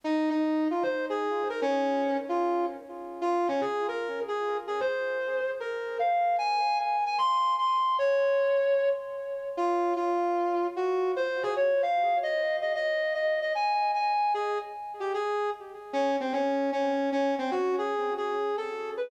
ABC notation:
X:1
M:4/4
L:1/8
Q:"Swing" 1/4=151
K:Bbdor
V:1 name="Brass Section"
E E2 F c A2 B | D3 F2 z3 | F D A B2 A2 A | c4 B2 f2 |
a2 a a c'2 c'2 | d5 z3 | F2 F4 _G2 | c A d f2 e2 e |
e2 e e a2 a2 | A z2 G A2 z2 | D C D2 D2 D C | ^F A2 A2 =A2 =B |]